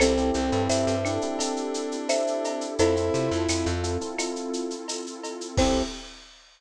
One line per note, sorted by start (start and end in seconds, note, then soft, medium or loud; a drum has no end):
0.00 0.31 C2 loud
0.00 0.13 C4 loud
0.00 0.30 C4 loud
0.00 2.76 C4 medium
0.00 0.13 E4 medium
0.00 2.76 E4 medium
0.00 0.13 G4 loud
0.00 2.76 G4 medium
0.00 0.13 A4 loud
0.00 2.76 A4 loud
0.00 0.62 A4 medium
0.00 0.62 C5 medium
0.00 cowbell medium
0.00 claves loud
0.00 shaker loud
0.17 0.45 C4 medium
0.17 0.45 E4 medium
0.17 0.45 G4 medium
0.17 0.45 A4 medium
0.17 shaker medium
0.34 0.51 C2 medium
0.34 0.94 C4 loud
0.34 shaker medium
0.52 0.68 G2 loud
0.52 0.94 C4 medium
0.52 0.94 E4 medium
0.52 0.94 G4 medium
0.52 0.94 A4 loud
0.52 shaker medium
0.69 0.85 G2 medium
0.69 1.87 C5 medium
0.69 1.87 E5 medium
0.69 tambourine medium
0.69 shaker loud
0.87 1.19 G2 medium
0.87 shaker medium
1.04 1.19 C4 medium
1.04 2.67 D4 medium
1.04 1.19 E4 medium
1.04 1.19 G4 medium
1.04 1.19 A4 medium
1.04 claves medium
1.04 shaker medium
1.21 1.37 C4 medium
1.21 1.37 E4 medium
1.21 1.37 G4 loud
1.21 1.37 A4 medium
1.21 shaker medium
1.39 1.95 C4 medium
1.39 1.95 E4 medium
1.39 1.95 G4 medium
1.39 1.95 A4 medium
1.39 cowbell medium
1.39 shaker loud
1.56 shaker medium
1.74 shaker medium
1.92 shaker medium
2.09 2.75 C5 medium
2.09 2.75 E5 medium
2.09 tambourine medium
2.09 cowbell medium
2.09 claves medium
2.09 shaker loud
2.27 shaker medium
2.44 cowbell medium
2.44 shaker medium
2.61 shaker medium
2.78 3.10 F2 loud
2.78 5.55 C4 medium
2.78 2.94 C4 loud
2.78 5.55 E4 medium
2.78 3.67 E4 loud
2.78 2.94 E4 loud
2.78 5.55 F4 medium
2.78 2.94 F4 loud
2.78 5.55 A4 medium
2.78 3.40 A4 medium
2.78 2.94 A4 loud
2.78 3.40 C5 medium
2.78 cowbell loud
2.78 shaker loud
2.96 3.24 C4 medium
2.96 3.24 E4 medium
2.96 3.24 F4 medium
2.96 3.24 A4 medium
2.96 shaker medium
3.14 3.30 C3 medium
3.14 shaker medium
3.31 3.47 F2 loud
3.31 3.73 C4 medium
3.31 3.73 E4 medium
3.31 3.73 F4 medium
3.31 3.73 A4 medium
3.31 shaker medium
3.49 3.65 F2 medium
3.49 tambourine medium
3.49 claves medium
3.49 shaker loud
3.66 3.98 F2 loud
3.66 shaker medium
3.83 3.97 C4 medium
3.83 3.97 E4 medium
3.83 3.97 F4 loud
3.83 3.97 A4 medium
3.83 shaker medium
4.01 4.16 C4 medium
4.01 4.16 E4 medium
4.01 4.16 F4 medium
4.01 4.16 A4 medium
4.01 shaker medium
4.18 4.75 C4 medium
4.18 4.75 E4 medium
4.18 4.75 F4 loud
4.18 4.75 A4 medium
4.18 cowbell medium
4.18 claves loud
4.18 shaker loud
4.36 shaker medium
4.53 shaker medium
4.70 shaker medium
4.88 tambourine medium
4.88 cowbell medium
4.88 shaker loud
5.06 shaker medium
5.24 cowbell medium
5.24 shaker medium
5.41 shaker medium
5.57 5.83 C2 loud
5.57 5.82 C4 loud
5.57 5.83 C4 loud
5.57 5.82 E4 medium
5.57 5.82 E4 loud
5.57 5.82 G4 loud
5.57 5.82 A4 loud
5.57 5.83 C5 loud
5.57 kick loud
5.57 crash loud